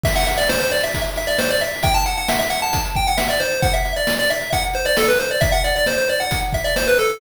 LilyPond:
<<
  \new Staff \with { instrumentName = "Lead 1 (square)" } { \time 4/4 \key e \minor \tempo 4 = 134 e''16 fis''16 e''16 d''16 c''16 c''16 d''16 e''8 r16 e''16 d''16 c''16 d''16 e''8 | g''16 a''16 fis''16 fis''16 e''16 e''16 fis''16 a''8 r16 g''16 fis''16 e''16 d''16 c''8 | fis''16 e''8 d''8 d''16 e''8 fis''16 r16 c''16 d''16 a'16 b'16 c''16 d''16 | e''16 fis''16 d''16 d''16 c''16 c''16 d''16 fis''8 r16 e''16 d''16 c''16 b'16 a'8 | }
  \new DrumStaff \with { instrumentName = "Drums" } \drummode { \time 4/4 <cymc bd>16 hh16 hh16 hh16 sn16 hh16 hh16 hh16 <hh bd>16 hh16 hh16 hh16 sn16 hh16 hh16 hho16 | <hh bd>16 hh16 hh16 hh16 sn16 hh16 hh16 hh16 <hh bd>16 hh16 <hh bd>16 hh16 sn16 hh16 hh16 hh16 | <hh bd>16 hh16 hh16 hh16 sn16 hh16 hh16 hh16 <hh bd>16 hh16 hh16 hh16 sn16 hh16 hh8 | <hh bd>16 hh16 hh16 hh16 sn16 hh16 hh16 hh16 <hh bd>16 hh16 <hh bd>16 hh16 sn16 hh16 hh16 hh16 | }
>>